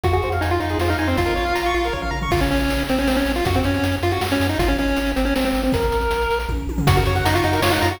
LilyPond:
<<
  \new Staff \with { instrumentName = "Lead 1 (square)" } { \time 3/4 \key des \major \tempo 4 = 158 ges'16 ges'8 r16 ees'16 f'16 ees'8 f'16 ees'16 ees'16 c'16 | f'2 r4 | \key bes \minor f'16 des'16 des'4 c'16 des'16 c'16 des'8 f'16 | ges'16 c'16 des'4 f'16 ges'16 r16 des'8 ees'16 |
f'16 des'16 des'4 c'16 des'16 c'16 c'8 c'16 | bes'2 r4 | \key des \major ges'16 ges'8 r16 ees'16 f'16 ees'8 f'16 ees'16 f'16 ges'16 | }
  \new Staff \with { instrumentName = "Lead 1 (square)" } { \time 3/4 \key des \major f'16 aes'16 c''16 f''16 aes''16 c'''16 f'16 aes'16 c''16 f''16 aes''16 c'''16 | f'16 bes'16 des''16 f''16 bes''16 des'''16 f'16 bes'16 des''16 f''16 bes''16 des'''16 | \key bes \minor r2. | r2. |
r2. | r2. | \key des \major ges'16 bes'16 des''16 ges''16 bes''16 des'''16 ges'16 bes'16 des''16 ges''16 bes''16 des'''16 | }
  \new Staff \with { instrumentName = "Synth Bass 1" } { \clef bass \time 3/4 \key des \major f,8 f,8 f,8 f,8 f,8 f,8 | bes,,8 bes,,8 bes,,8 bes,,8 bes,,8 bes,,8 | \key bes \minor bes,,8 bes,,8 bes,,8 bes,,8 bes,,8 bes,,8 | ges,8 ges,8 ges,8 ges,8 ges,8 ges,8 |
aes,,8 aes,,8 aes,,8 aes,,8 aes,,8 aes,,8 | bes,,8 bes,,8 bes,,8 bes,,8 bes,,8 bes,,8 | \key des \major ges,8 ges,8 ges,8 ges,8 ges,8 ges,8 | }
  \new DrumStaff \with { instrumentName = "Drums" } \drummode { \time 3/4 <hh bd>16 hh16 hh16 hh16 hh16 hh16 hh16 hh16 sn16 hh16 hh16 hh16 | <hh bd>16 hh16 hh16 hh16 hh16 hh16 hh16 hh16 <bd tommh>16 tomfh16 tommh16 tomfh16 | <cymc bd>16 hh16 hh16 hh16 hh16 hh16 hh16 hh16 sn16 hh16 hh16 hh16 | <hh bd>16 hh16 hh16 hh16 hh16 hh16 hh16 hh16 sn16 hh16 hh16 hh16 |
<hh bd>16 hh16 hh16 hh16 hh16 hh16 hh16 hh16 sn16 hh16 hh16 hho16 | <hh bd>16 hh16 hh16 hh16 hh16 hh16 hh16 hh16 <bd tommh>8 tommh16 tomfh16 | <hh bd>16 hh16 hh16 hh16 hh16 hh16 hh16 hh16 sn16 hh16 hh16 hh16 | }
>>